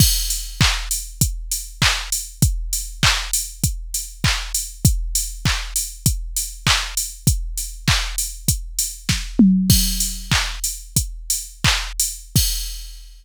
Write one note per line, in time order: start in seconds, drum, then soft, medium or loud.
0.00 kick loud
0.00 crash loud
0.30 open hi-hat medium
0.61 kick loud
0.61 clap loud
0.91 open hi-hat medium
1.21 kick loud
1.21 closed hi-hat loud
1.52 open hi-hat medium
1.82 kick medium
1.82 clap loud
2.12 open hi-hat medium
2.42 kick loud
2.42 closed hi-hat loud
2.73 open hi-hat medium
3.03 kick loud
3.03 clap loud
3.33 open hi-hat loud
3.64 kick medium
3.64 closed hi-hat loud
3.94 open hi-hat medium
4.24 kick loud
4.24 clap loud
4.54 open hi-hat medium
4.85 kick loud
4.85 closed hi-hat loud
5.15 open hi-hat medium
5.45 kick loud
5.45 clap loud
5.76 open hi-hat medium
6.06 kick loud
6.06 closed hi-hat loud
6.36 open hi-hat medium
6.67 kick medium
6.67 clap loud
6.97 open hi-hat medium
7.27 kick loud
7.27 closed hi-hat loud
7.57 open hi-hat medium
7.88 kick loud
7.88 clap loud
8.18 open hi-hat medium
8.48 kick medium
8.48 closed hi-hat loud
8.79 open hi-hat medium
9.09 kick medium
9.09 snare medium
9.39 mid tom loud
9.70 kick loud
9.70 crash loud
10.00 open hi-hat medium
10.32 kick medium
10.32 clap loud
10.64 open hi-hat medium
10.96 kick medium
10.96 closed hi-hat loud
11.30 open hi-hat medium
11.64 kick loud
11.64 clap loud
11.99 open hi-hat loud
12.36 kick loud
12.36 crash loud